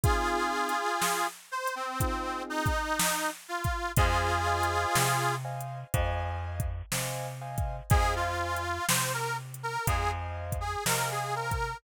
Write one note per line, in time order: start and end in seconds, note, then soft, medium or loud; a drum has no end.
0.03 0.73 C4 medium
0.03 0.73 D#4 medium
0.03 1.27 F4 loud
0.03 0.73 F4 loud
0.03 1.27 G#4 loud
0.03 0.73 G#4 medium
0.03 kick loud
0.03 closed hi-hat loud
0.69 closed hi-hat medium
1.02 snare loud
1.51 1.75 C5 loud
1.67 closed hi-hat medium
1.75 2.43 C4 medium
2.00 2.69 C4 loud
2.00 2.69 D#4 medium
2.00 2.69 F4 medium
2.00 2.69 G#4 medium
2.00 kick loud
2.00 closed hi-hat loud
2.50 3.30 D#4 loud
2.66 kick loud
2.66 closed hi-hat medium
2.99 snare loud
3.48 3.92 F4 medium
3.64 kick loud
3.64 closed hi-hat medium
3.97 4.86 F2 loud
3.97 5.35 F4 loud
3.97 5.35 G#4 loud
3.97 4.32 C5 medium
3.97 4.32 D#5 medium
3.97 4.32 F5 medium
3.97 4.32 G#5 medium
3.97 kick loud
3.97 closed hi-hat loud
4.46 5.15 C5 medium
4.46 5.15 D#5 medium
4.46 5.15 F5 medium
4.46 5.15 G#5 medium
4.63 closed hi-hat medium
4.95 5.84 C3 medium
4.95 snare loud
5.45 5.79 C5 medium
5.45 5.79 D#5 medium
5.45 5.79 F5 medium
5.45 5.79 G#5 medium
5.60 closed hi-hat medium
5.94 6.82 F2 loud
5.94 6.63 C5 loud
5.94 6.63 D#5 medium
5.94 6.63 F5 medium
5.94 6.63 G#5 loud
5.94 kick loud
5.94 closed hi-hat loud
6.60 kick loud
6.60 closed hi-hat medium
6.92 7.81 C3 medium
6.92 7.27 C5 medium
6.92 7.27 D#5 medium
6.92 7.27 F5 medium
6.92 7.27 G#5 medium
6.92 snare loud
7.41 7.76 C5 medium
7.41 7.76 D#5 medium
7.41 7.76 F5 medium
7.41 7.76 G#5 medium
7.58 kick loud
7.58 closed hi-hat medium
7.90 8.79 F2 medium
7.90 8.14 G#4 loud
7.90 8.59 C5 medium
7.90 8.59 D#5 medium
7.90 8.59 F5 medium
7.90 8.59 G#5 loud
7.90 kick loud
7.90 closed hi-hat loud
8.15 8.86 F4 loud
8.56 closed hi-hat medium
8.89 9.77 C3 medium
8.89 9.12 C5 medium
8.89 snare loud
9.14 9.37 A#4 loud
9.54 closed hi-hat medium
9.63 9.86 A#4 loud
9.87 10.76 F2 medium
9.87 10.11 G#4 loud
9.87 10.56 C5 medium
9.87 10.56 D#5 medium
9.87 10.56 F5 medium
9.87 10.56 G#5 medium
9.87 kick loud
9.87 closed hi-hat loud
10.52 kick medium
10.52 closed hi-hat medium
10.60 10.84 G#4 medium
10.86 11.74 C3 medium
10.86 11.09 A#4 loud
10.86 11.55 C5 medium
10.86 11.55 D#5 medium
10.86 11.55 F5 medium
10.86 11.55 G#5 medium
10.86 snare loud
11.11 11.34 G#4 medium
11.35 11.77 A#4 medium
11.51 kick medium
11.51 closed hi-hat medium